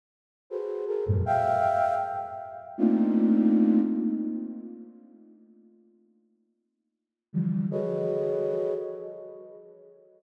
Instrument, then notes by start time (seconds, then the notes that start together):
flute
0.50 F#4 G#4 A4 B4 C5
0.87 G#4 A4 A#4
1.06 F2 F#2 G2 G#2 A#2
1.26 E5 F5 G5
2.78 A3 A#3 C4 D4 D#4 F4
7.33 D3 E3 F3 G3
7.71 F#4 G#4 A4 B4 C#5 D#5